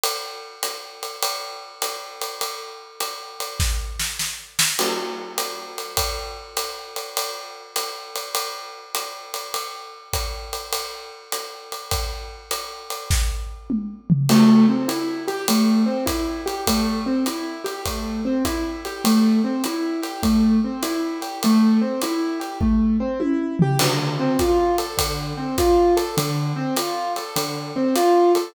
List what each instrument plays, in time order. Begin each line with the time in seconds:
0.04 ride
0.63 hi-hat pedal, ride
1.03 ride
1.23 ride
1.82 hi-hat pedal, ride
2.22 ride
2.41 ride
3.00 hi-hat pedal, ride
3.40 ride
3.60 kick, snare
4.00 snare
4.19 snare
4.59 snare
4.79 crash, ride
5.38 hi-hat pedal, ride
5.78 ride
5.97 kick, ride
6.57 hi-hat pedal, ride
6.96 ride
7.17 ride
7.76 hi-hat pedal, ride
8.16 ride
8.35 ride
8.95 hi-hat pedal, ride
9.34 ride
9.54 ride
10.13 kick, hi-hat pedal, ride
10.53 ride
10.73 ride
11.32 hi-hat pedal, ride
11.72 ride
11.91 kick, ride
12.51 hi-hat pedal, ride
12.90 ride
13.11 kick, snare
13.70 mid tom
14.10 floor tom
14.29 acoustic grand piano A3, crash, ride
14.69 acoustic grand piano C4
14.88 acoustic grand piano E4, hi-hat pedal, ride
15.28 acoustic grand piano G4, ride
15.48 acoustic grand piano A3, ride
15.86 acoustic grand piano C4
16.06 acoustic grand piano E4, kick, hi-hat pedal, ride
16.46 acoustic grand piano G4, ride
16.67 acoustic grand piano A3, kick, ride
17.06 acoustic grand piano C4
17.26 acoustic grand piano E4, hi-hat pedal, ride
17.64 acoustic grand piano G4, ride
17.85 acoustic grand piano A3, kick, ride
18.25 acoustic grand piano C4
18.45 acoustic grand piano E4, kick, hi-hat pedal, ride
18.85 acoustic grand piano G4, ride
19.04 acoustic grand piano A3, ride
19.44 acoustic grand piano C4
19.64 acoustic grand piano E4, hi-hat pedal, ride
20.02 acoustic grand piano G4, ride
20.23 acoustic grand piano A3, kick, ride
20.64 acoustic grand piano C4
20.83 acoustic grand piano E4, hi-hat pedal, ride
21.21 acoustic grand piano G4, ride
21.43 acoustic grand piano A3, ride
21.81 acoustic grand piano C4
22.01 acoustic grand piano E4, hi-hat pedal, ride
22.40 acoustic grand piano G4, ride
22.61 acoustic grand piano A3, kick
23.00 acoustic grand piano C4
23.20 acoustic grand piano E4, high tom
23.59 acoustic grand piano G4, floor tom
23.79 acoustic grand piano D3, crash, ride
24.20 acoustic grand piano C4
24.39 acoustic grand piano F4, kick, hi-hat pedal, ride
24.78 acoustic grand piano A4, ride
24.97 acoustic grand piano D3, kick, ride
25.37 acoustic grand piano C4
25.58 acoustic grand piano F4, kick, hi-hat pedal, ride
25.97 acoustic grand piano A4, ride
26.17 acoustic grand piano D3, ride
26.56 acoustic grand piano C4
26.76 acoustic grand piano F4, hi-hat pedal, ride
27.16 acoustic grand piano A4, ride
27.36 acoustic grand piano D3, ride
27.76 acoustic grand piano C4
27.96 acoustic grand piano F4, hi-hat pedal, ride
28.35 acoustic grand piano A4, ride